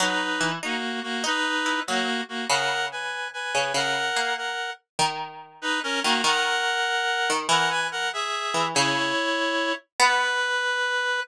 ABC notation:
X:1
M:6/8
L:1/8
Q:3/8=96
K:B
V:1 name="Clarinet"
[DB]3 [A,F]2 [A,F] | [DB]3 [A,F]2 [A,F] | [Af]2 [Bg]2 [Bg]2 | [Af]3 [Af]2 z |
z3 [DB] [CA] [A,F] | [Af]6 | [Af] [Bg] [Af] [Ge]3 | [Ec]5 z |
B6 |]
V:2 name="Harpsichord"
F,2 E, D z2 | D2 E F, z2 | C,5 C, | C,2 A,2 z2 |
D,5 D, | D,5 D, | E,5 E, | C,2 z4 |
B,6 |]